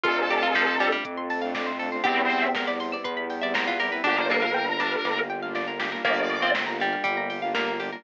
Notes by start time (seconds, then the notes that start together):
0.04 F2 A3 C4 D4 F4 A4, kick, closed hi-hat
0.18 C5
0.30 G4 D5, open hi-hat
0.42 F4 F5
0.55 F3 A5, kick, snare
0.67 C6
0.80 G3 D6, open hi-hat
0.92 G3 F6
1.04 F2 A3 C4 F4 A4 D6, kick, closed hi-hat
1.18 C6
1.30 A5, open hi-hat
1.42 A3 C4 D4 F4 F5
1.55 D5, kick, snare
1.67 C5
1.79 A3 C4 D4 F4 A4, open hi-hat
1.92 A3 C4 D4 F4 C5
2.04 E2 G3 B3 C4 E4 G4, kick, closed hi-hat
2.17 B4
2.30 C5, open hi-hat
2.42 E5
2.55 A#4 G5, kick, snare
2.67 D5 B5
2.80 C6, open hi-hat
2.92 D5 E6
3.04 E2 G3 B3 E4 G4 B4 C6, kick, closed hi-hat
3.17 B5
3.30 G5, open hi-hat
3.42 G3 B3 C4 E4 D5 E5
3.54 A#4 C5, kick, snare
3.67 F4 B4
3.80 G3 B3 C4 E4 G4 A#4, open hi-hat
3.92 G3 B3 C4 E4 B4
4.04 G1 G3 A#3 D4 F4 G4, kick, snare
4.17 A#4 C5
4.30 A#3 A#4 D5, snare
4.42 A#4 F5
4.54 G5
4.68 A#5
4.80 D4 D6, snare
4.92 F6
5.05 G1 G3 A#3 F4 G4 D6, snare
5.17 A#5
5.30 G5
5.42 G3 A#3 D4 F4 F5
5.55 D5, snare
5.68 A#4
5.79 G3 A#3 D4 F4 G4, snare
5.92 G3 A#3 D4 F4 A#4
6.05 G1 G3 A#3 D4 F4 G4 D5, kick, closed hi-hat
6.17 A#4
6.30 D5, open hi-hat
6.42 C4 F5
6.55 G5, kick, snare
6.67 A#5
6.80 G3 D6, open hi-hat
6.93 F6
7.03 G1 G3 A#3 F4 G4 D6, kick, closed hi-hat
7.17 A#5
7.30 G5, open hi-hat
7.42 G3 A#3 D4 F4 F5
7.55 A#3 D5, kick, snare
7.67 A#4
7.80 G3 A#3 D4 F4 G4, open hi-hat
7.92 G3 A#3 D4 F4 A#4